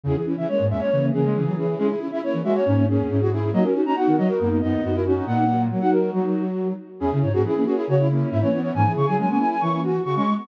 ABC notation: X:1
M:4/4
L:1/16
Q:1/4=138
K:C#dor
V:1 name="Flute"
G z2 e c2 e c3 G4 G2 | G z2 e c2 e c3 G4 G2 | d z2 a f2 d A3 d4 F2 | f4 z f A2 F6 z2 |
G2 c G G G G G c2 z2 e c2 c | g2 c' g g g g g c'2 z2 c' c'2 c' |]
V:2 name="Flute"
[CE] [EG] [CE] [CE] [A,C]2 [A,C] [A,C] [A,C]2 [A,C]2 [CE] [EG] [CE] [CE] | [CE] [EG] [CE] [CE] [A,C]2 [A,C] [A,C] [A,C]2 [A,C]2 [CE] [EG] [CE] [CE] | [DF] [FA] [DF] [DF] [B,D]2 [B,D] [B,D] [B,D]2 [B,D]2 [DF] [FA] [DF] [DF] | [B,D]2 [F,A,]2 [F,A,] [DF]7 z4 |
[EG] [CE]2 [A,C] [CE] [A,C] [A,C]3 [CE] [A,C]3 [A,C] [CE]2 | [A,C] [EG]2 [EG] [A,C] [A,C]7 z4 |]
V:3 name="Flute"
C, E,2 E, G,2 G,2 C,2 C,2 C, F, E,2 | C E2 E E2 F2 C2 C2 C F E2 | A, C2 C F2 F2 A,2 B,2 B, E C2 | A,4 F,4 F,6 z2 |
C C z F E2 F E F E3 E2 B, B, | E, z C, F, F, B, E2 E2 F2 F C G, B, |]
V:4 name="Flute" clef=bass
E,, z4 G,, E,, z E,2 E, G, E,4 | G, z4 E, G, z G,,2 G,, E,, G,,4 | F, z4 D, F, z F,,2 F,, D,, F,,4 | A,,4 z12 |
E,, C, G,, G,, E,2 z2 C,4 G,, E,3 | G,, E, C, C, G,2 z2 E,4 C, G,3 |]